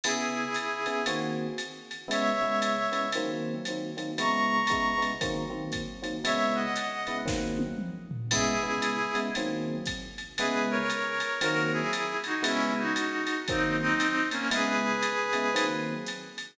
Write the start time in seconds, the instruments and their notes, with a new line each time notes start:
0.04 electric piano 1 C#3 B3 E4 G#4, clarinet E4 G#4, crash, ride
0.54 hi-hat pedal, ride
0.86 electric piano 1 C#3 B3 E4 G#4, ride
1.06 electric piano 1 D#3 A#3 C4 F#4, ride
1.58 hi-hat pedal, ride
1.91 ride
2.08 electric piano 1 C#3 G#3 B3 E4, clarinet C#5 E5, ride
2.41 electric piano 1 C#3 G#3 B3 E4
2.62 hi-hat pedal, ride
2.92 electric piano 1 C#3 G#3 B3 E4, ride
3.12 electric piano 1 D#3 F#3 A#3 C4, ride
3.65 electric piano 1 D#3 F#3 A#3 C4, hi-hat pedal, ride
3.97 electric piano 1 D#3 F#3 A#3 C4, ride
4.18 electric piano 1 C#3 G#3 B3 E4, clarinet A#5 C#6, ride
4.67 electric piano 1 C#3 G#3 B3 E4, kick, hi-hat pedal, ride
4.98 electric piano 1 C#3 G#3 B3 E4
5.02 ride
5.21 electric piano 1 D#3 F#3 A#3 C4, kick, ride
5.50 electric piano 1 D#3 F#3 A#3 C4
5.72 kick, hi-hat pedal, ride
6.02 electric piano 1 D#3 F#3 A#3 C4, ride
6.24 electric piano 1 C#3 G#3 B3 E4, clarinet C#5 E5, ride
6.55 clarinet D#5 F#5
6.76 hi-hat pedal, ride
7.07 electric piano 1 C#3 G#3 B3 E4, ride
7.26 electric piano 1 D#3 F#3 A#3 C4, kick, snare
7.59 high tom
7.78 mid tom
8.11 floor tom
8.31 electric piano 1 C#3 G#3 B3 E4, clarinet E4 G#4, kick, crash, ride
8.63 electric piano 1 C#3 G#3 B3 E4
8.82 hi-hat pedal, ride
9.15 electric piano 1 C#3 G#3 B3 E4, ride
9.35 electric piano 1 D#3 F#3 A#3 C4, ride
9.85 kick, hi-hat pedal, ride
10.18 ride
10.37 electric piano 1 C#3 G#3 B3 E4, clarinet G#4 B4, ride
10.70 clarinet A#4 C#5
10.90 hi-hat pedal, ride
11.20 ride
11.41 electric piano 1 D#3 F#3 A#3 C4, clarinet F#4 A#4, ride
11.73 clarinet E4 G#4
11.93 hi-hat pedal, ride
12.24 clarinet D#4 F#4, ride
12.42 electric piano 1 C#3 G#3 B3 E4, clarinet C#4 E4, ride
12.77 clarinet D#4 F#4
12.96 hi-hat pedal, ride
13.27 ride
13.48 electric piano 1 D#3 F#3 A#3 C4, clarinet C4 D#4, kick, ride
13.80 clarinet C4 D#4
14.00 hi-hat pedal, ride
14.31 clarinet A#3 C#4, ride
14.51 electric piano 1 C#3 G#3 B3 E4, clarinet G#4 B4, ride
15.02 hi-hat pedal, ride
15.33 electric piano 1 C#3 G#3 B3 E4, ride
15.54 electric piano 1 D#3 F#3 A#3 C4, ride
16.06 hi-hat pedal, ride
16.38 ride